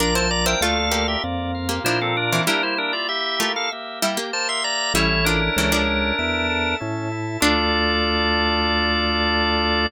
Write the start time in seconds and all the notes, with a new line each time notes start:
0.00 A#1 A#3 D4 F4 A#4 D5 A#5
0.15 E4 C5 A5
0.30 D5 A#5
0.46 E4 A#4 C5 G5
0.61 D2 A3 F4 A4 F5
0.91 A#3 G4 A#4
1.08 G4 E5
1.23 F2 A#3 F4 A#4 D5
1.55 F5
1.69 A#3 G4
1.84 A#2 F3 D4 E4 A#4 C5
2.01 C4 A4
2.17 D4 A#4 D5
2.32 E3 C4
2.47 G3 A#3 D4 E4 G4 A#4
2.63 E4 C5
2.78 D4 A#4 E5
2.93 F4 D5
3.09 G4 E5 G5
3.40 A3 F4 A#4
3.56 A4 F5
3.71 A#3 G4 A#4 E5
4.02 G3 E4 G5
4.17 A#3 G4
4.33 A#4 C5 A5
4.49 E5 C6
4.64 D5 E5 A#5
4.94 A1 G3 C#4 E4 A4 C#5 E5
5.25 F3 D4 E4 A#4
5.56 C#2 E3 C#4 A4
5.72 F3 D4
5.87 C#4
6.18 E2 E4 A4 E5 A5
6.50 A4
6.80 A2 C#4
7.11 E4
7.40 D2 D4 F4 A4 D5